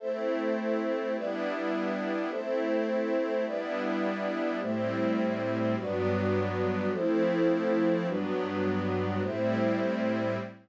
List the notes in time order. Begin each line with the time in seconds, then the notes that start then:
0.00 A3 C4 E4 A4 C5 E5
1.15 G3 B3 D4 E4 G4 B4 D5 E5
2.30 A3 C4 E4 A4 C5 E5
3.45 G3 B3 D4 E4 G4 B4 D5 E5
4.61 A2 G3 A3 C4 E4 G4 C5 E5
5.77 G2 F#3 G3 B3 D4 F#4 B4 D5
6.92 F3 A3 C4 E4 A4 C5
8.07 G2 F#3 G3 B3 D4 F#4 B4
9.22 A2 G3 A3 C4 E4 G4 C5 E5